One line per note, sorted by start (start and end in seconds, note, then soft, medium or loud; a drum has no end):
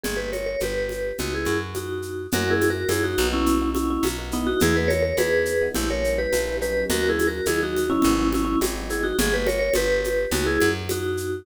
0.04 0.56 G1 medium
0.04 0.17 G#4 medium
0.04 low conga medium
0.04 shaker medium
0.17 0.30 G4 medium
0.17 0.30 B4 medium
0.33 0.46 A#4 medium
0.33 0.46 C#5 medium
0.33 high conga medium
0.33 shaker medium
0.46 0.60 A#4 medium
0.46 0.60 C#5 medium
0.60 1.12 G1 medium
0.60 1.17 G4 medium
0.60 1.17 B4 medium
0.60 high conga medium
0.60 shaker medium
0.89 high conga medium
0.89 shaker medium
1.18 1.47 C#2 loud
1.18 1.33 D#4 medium
1.18 1.33 F#4 medium
1.18 low conga medium
1.18 shaker medium
1.35 1.59 E4 medium
1.35 1.59 G#4 medium
1.45 2.27 F#2 loud
1.45 high conga medium
1.45 shaker medium
1.74 2.27 D#4 medium
1.74 2.27 F#4 medium
1.74 high conga medium
1.74 shaker medium
2.02 shaker medium
2.32 2.85 F#2 loud
2.32 2.44 A#3 loud
2.32 2.44 C#4 loud
2.32 2.44 E4 loud
2.32 2.44 F#4 loud
2.32 2.52 F#4 loud
2.32 2.52 A#4 loud
2.32 low conga loud
2.32 shaker medium
2.47 2.81 A#3 loud
2.47 2.81 C#4 loud
2.47 2.81 E4 medium
2.47 2.68 E4 loud
2.47 2.81 F#4 medium
2.47 2.68 G#4 loud
2.61 high conga medium
2.61 shaker medium
2.70 2.88 F#4 medium
2.70 2.88 A#4 loud
2.89 3.16 F#2 loud
2.89 3.17 A#3 medium
2.89 3.17 C#4 medium
2.89 3.03 E4 loud
2.89 3.17 E4 medium
2.89 3.17 F#4 medium
2.89 3.03 G#4 loud
2.89 high conga loud
2.89 shaker medium
3.04 3.27 D#4 loud
3.04 3.27 F#4 loud
3.18 3.98 B1 loud
3.18 3.59 A#3 loud
3.18 3.59 B3 loud
3.18 3.59 D#4 loud
3.18 3.59 F#4 loud
3.18 high conga medium
3.18 shaker medium
3.33 3.69 C#4 loud
3.33 3.69 E4 loud
3.46 low conga medium
3.46 shaker medium
3.61 4.07 A#3 loud
3.61 4.07 B3 medium
3.61 4.07 D#4 loud
3.61 4.07 F#4 loud
3.75 3.89 C#4 loud
3.75 3.89 E4 loud
3.75 high conga medium
3.75 shaker medium
3.90 4.04 C#4 loud
3.90 4.04 E4 loud
4.03 4.54 B1 loud
4.03 high conga loud
4.03 shaker medium
4.18 4.30 A#3 loud
4.18 4.30 B3 loud
4.18 4.30 D#4 medium
4.18 4.30 F#4 loud
4.32 4.73 G#3 loud
4.32 4.73 B3 loud
4.32 4.47 B3 loud
4.32 4.73 D#4 loud
4.32 4.46 D#4 loud
4.32 4.73 E4 loud
4.32 shaker medium
4.47 4.60 D#4 loud
4.47 4.60 F#4 loud
4.60 5.13 E2 loud
4.60 4.76 E4 loud
4.60 4.76 G#4 loud
4.60 low conga loud
4.60 shaker medium
4.75 5.10 G#3 medium
4.75 5.10 B3 loud
4.75 5.10 D#4 loud
4.75 5.10 E4 medium
4.75 4.90 G#4 loud
4.75 4.90 B4 loud
4.88 5.02 A#4 loud
4.88 5.02 C#5 loud
4.88 high conga medium
4.88 shaker medium
5.03 5.16 A#4 medium
5.03 5.16 C#5 loud
5.17 5.69 E2 loud
5.17 5.53 G#3 medium
5.17 5.53 B3 loud
5.17 5.53 D#4 medium
5.17 5.53 E4 medium
5.17 5.69 G#4 loud
5.17 5.69 B4 loud
5.17 high conga loud
5.17 shaker medium
5.45 shaker medium
5.61 5.73 G#3 medium
5.61 5.73 B3 loud
5.61 5.73 D#4 medium
5.61 5.73 E4 medium
5.75 6.27 A#1 loud
5.75 5.87 G3 loud
5.75 5.87 A#3 loud
5.75 5.87 C#4 loud
5.75 5.89 E4 loud
5.75 5.87 E4 loud
5.75 5.89 G4 loud
5.75 low conga loud
5.75 shaker medium
5.90 6.35 G3 loud
5.90 6.35 A#3 loud
5.90 6.35 C#4 medium
5.90 6.35 E4 medium
5.90 6.18 A#4 medium
5.90 6.18 C#5 loud
6.04 shaker medium
6.18 6.56 G4 loud
6.18 6.56 B4 loud
6.33 6.84 A#1 medium
6.33 high conga medium
6.33 shaker medium
6.47 6.58 G3 medium
6.47 6.58 A#3 medium
6.47 6.58 C#4 medium
6.47 6.58 E4 loud
6.61 7.01 F#3 loud
6.61 7.01 A#3 loud
6.61 7.01 C#4 loud
6.61 7.01 D#4 loud
6.61 6.85 G4 loud
6.61 6.85 B4 loud
6.61 shaker medium
6.90 7.41 D#2 loud
6.90 7.08 F#4 loud
6.90 7.08 A#4 loud
6.90 low conga loud
6.90 shaker loud
7.04 7.38 F#3 loud
7.04 7.38 A#3 medium
7.04 7.38 C#4 loud
7.04 7.38 D#4 medium
7.09 7.27 E4 loud
7.09 7.27 G#4 loud
7.19 high conga medium
7.19 shaker medium
7.27 7.45 F#4 medium
7.27 7.45 A#4 loud
7.46 7.98 D#2 loud
7.46 7.81 F#3 medium
7.46 7.81 A#3 loud
7.46 7.81 C#4 loud
7.46 7.81 D#4 medium
7.46 7.61 E4 loud
7.46 7.61 G#4 loud
7.46 high conga medium
7.46 shaker loud
7.63 7.91 D#4 loud
7.63 7.91 F#4 loud
7.77 high conga medium
7.77 shaker medium
7.90 8.01 F#3 loud
7.90 8.01 A#3 medium
7.90 8.01 C#4 loud
7.90 8.28 C#4 loud
7.90 8.01 D#4 loud
7.90 8.28 E4 loud
8.02 8.56 G#1 loud
8.02 8.15 F#3 loud
8.02 8.15 G#3 loud
8.02 8.15 B3 loud
8.02 8.15 D#4 loud
8.02 low conga loud
8.02 shaker medium
8.18 8.64 F#3 loud
8.18 8.64 G#3 medium
8.18 8.64 B3 medium
8.18 8.64 D#4 loud
8.33 8.44 C#4 loud
8.33 8.44 E4 loud
8.33 high conga medium
8.33 shaker medium
8.45 8.58 C#4 loud
8.45 8.58 E4 loud
8.61 9.13 G#1 loud
8.61 high conga loud
8.61 shaker loud
8.75 8.87 F#3 loud
8.75 8.87 G#3 loud
8.75 8.87 B3 loud
8.75 8.87 D#4 medium
8.90 9.13 F#3 medium
8.90 9.13 G#3 medium
8.90 9.13 B3 medium
8.90 9.13 D#4 loud
8.90 9.04 E4 medium
8.90 9.04 G#4 loud
8.90 shaker medium
9.03 9.17 D#4 loud
9.03 9.17 F#4 loud
9.19 9.70 G1 loud
9.19 9.33 G#4 loud
9.19 low conga loud
9.19 shaker loud
9.34 9.47 G4 medium
9.34 9.47 B4 loud
9.47 9.59 A#4 loud
9.47 9.59 C#5 loud
9.47 high conga medium
9.47 shaker medium
9.59 9.73 A#4 loud
9.59 9.73 C#5 loud
9.74 10.26 G1 loud
9.74 10.30 G4 loud
9.74 10.30 B4 loud
9.74 high conga loud
9.74 shaker medium
10.04 high conga medium
10.04 shaker medium
10.31 10.59 C#2 loud
10.31 10.46 D#4 loud
10.31 10.46 F#4 loud
10.31 low conga loud
10.31 shaker medium
10.46 10.71 E4 loud
10.46 10.71 G#4 loud
10.60 11.43 F#2 loud
10.60 high conga medium
10.60 shaker medium
10.89 11.42 D#4 medium
10.89 11.42 F#4 loud
10.89 high conga loud
10.89 shaker medium
11.17 shaker medium